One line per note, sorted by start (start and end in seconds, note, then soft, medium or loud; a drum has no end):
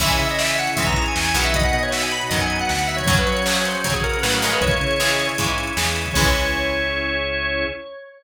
0.00 0.17 C#2 loud
0.00 0.69 E3 loud
0.00 0.69 G#3 loud
0.00 0.69 C#4 loud
0.00 1.51 C#4 medium
0.00 1.51 E4 medium
0.00 1.51 G#4 medium
0.00 0.10 E5 loud
0.00 kick medium
0.00 crash loud
0.10 0.19 G#5 loud
0.10 closed hi-hat medium
0.19 0.69 C#3 medium
0.19 0.28 E5 loud
0.19 closed hi-hat medium
0.29 0.40 D#5 loud
0.29 closed hi-hat medium
0.39 0.48 E5 loud
0.39 snare loud
0.48 0.58 E5 loud
0.48 closed hi-hat medium
0.58 0.68 F#5 loud
0.58 closed hi-hat medium
0.67 closed hi-hat medium
0.76 1.09 G#2 medium
0.76 1.32 E3 medium
0.76 1.32 G#3 medium
0.76 1.32 C#4 medium
0.76 0.85 E5 loud
0.76 kick medium
0.76 closed hi-hat loud
0.86 1.03 A#5 medium
0.86 kick loud
0.86 closed hi-hat medium
0.96 closed hi-hat medium
1.06 1.16 G#5 loud
1.06 closed hi-hat medium
1.15 1.33 E2 medium
1.15 1.32 G#5 loud
1.15 snare loud
1.25 closed hi-hat medium
1.34 1.70 B1 medium
1.34 2.23 D#3 medium
1.34 2.23 F#3 loud
1.34 2.23 B3 loud
1.34 1.44 F#5 loud
1.34 closed hi-hat medium
1.44 1.54 E5 loud
1.44 closed hi-hat medium
1.54 3.05 B3 medium
1.54 3.05 D#4 medium
1.54 3.05 F#4 medium
1.54 1.65 D#5 loud
1.54 kick loud
1.54 closed hi-hat loud
1.63 1.74 F#5 medium
1.63 closed hi-hat medium
1.73 2.22 B2 medium
1.73 1.83 D#5 loud
1.73 closed hi-hat medium
1.83 1.92 C#5 loud
1.83 closed hi-hat medium
1.92 2.02 E5 loud
1.92 snare loud
2.02 2.12 G#5 medium
2.02 closed hi-hat medium
2.11 2.21 B5 loud
2.11 closed hi-hat medium
2.21 closed hi-hat medium
2.29 2.63 F#2 medium
2.29 3.00 D#3 medium
2.29 3.00 F#3 medium
2.29 3.00 B3 medium
2.29 2.38 D#5 medium
2.29 kick medium
2.29 closed hi-hat medium
2.40 2.56 G#5 medium
2.40 closed hi-hat medium
2.50 closed hi-hat medium
2.59 2.69 F#5 loud
2.59 closed hi-hat medium
2.69 3.02 D2 medium
2.69 2.88 F#5 loud
2.69 snare medium
2.79 closed hi-hat medium
2.87 2.97 E5 loud
2.87 closed hi-hat medium
2.97 3.06 C#5 loud
2.97 kick medium
2.97 closed hi-hat medium
3.06 3.24 F#2 loud
3.06 3.42 C#3 loud
3.06 3.42 F#3 loud
3.06 4.58 C#4 medium
3.06 4.58 F#4 medium
3.06 3.15 C#5 loud
3.06 kick loud
3.06 closed hi-hat loud
3.17 3.27 B4 loud
3.17 closed hi-hat medium
3.27 3.76 F#3 medium
3.27 3.44 C#5 loud
3.27 closed hi-hat medium
3.37 closed hi-hat medium
3.45 3.81 C#3 medium
3.45 3.81 F#3 medium
3.45 3.55 C#5 loud
3.45 snare loud
3.56 3.65 C#5 loud
3.56 closed hi-hat medium
3.65 3.83 C5 medium
3.65 closed hi-hat medium
3.75 closed hi-hat medium
3.84 4.17 C#3 medium
3.84 4.19 C#3 medium
3.84 4.19 F#3 medium
3.84 3.94 C#5 loud
3.84 kick medium
3.84 closed hi-hat loud
3.94 4.03 G#4 loud
3.94 kick medium
3.94 closed hi-hat medium
4.03 4.21 A#4 loud
4.03 closed hi-hat medium
4.13 closed hi-hat medium
4.22 4.56 A2 medium
4.22 4.42 C#3 medium
4.22 4.42 F#3 medium
4.22 4.31 B4 loud
4.22 snare loud
4.33 4.42 A#4 medium
4.33 closed hi-hat medium
4.42 4.96 C#3 medium
4.42 4.96 E3 medium
4.42 4.96 G#3 loud
4.42 4.52 A#4 loud
4.42 closed hi-hat medium
4.52 4.62 B4 loud
4.52 closed hi-hat medium
4.61 4.78 C#2 medium
4.61 6.13 C#4 medium
4.61 6.13 E4 medium
4.61 6.13 G#4 medium
4.61 5.27 C#5 loud
4.61 kick loud
4.61 closed hi-hat medium
4.71 closed hi-hat medium
4.81 5.30 C#3 medium
4.81 closed hi-hat medium
4.91 closed hi-hat medium
5.00 5.34 C#3 medium
5.00 5.34 E3 medium
5.00 5.34 G#3 medium
5.00 snare loud
5.10 closed hi-hat medium
5.19 closed hi-hat medium
5.29 closed hi-hat medium
5.38 5.72 G#2 medium
5.38 5.73 C#3 medium
5.38 5.73 E3 medium
5.38 5.73 G#3 medium
5.38 kick medium
5.38 closed hi-hat loud
5.48 closed hi-hat medium
5.58 closed hi-hat medium
5.67 closed hi-hat medium
5.77 6.10 E2 medium
5.77 6.12 C#3 medium
5.77 6.12 E3 medium
5.77 6.12 G#3 medium
5.77 snare loud
5.86 closed hi-hat medium
5.96 closed hi-hat medium
6.06 kick medium
6.06 closed hi-hat medium
6.14 7.66 C#2 loud
6.14 7.66 E3 medium
6.14 7.66 G#3 loud
6.14 7.66 C#4 medium
6.14 7.67 C#4 loud
6.14 7.67 E4 loud
6.14 7.67 G#4 medium
6.14 7.64 C#5 loud
6.14 kick loud
6.14 crash loud